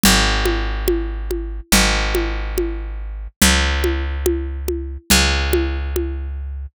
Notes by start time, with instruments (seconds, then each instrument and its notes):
0.04 electric bass (finger) G#1, low conga
0.46 high conga
0.88 high conga
1.31 high conga
1.72 electric bass (finger) G#1, low conga
2.15 high conga
2.58 high conga
3.42 electric bass (finger) C#2, low conga
3.84 high conga
4.26 high conga
4.68 high conga
5.10 electric bass (finger) C#2, low conga
5.53 high conga
5.96 high conga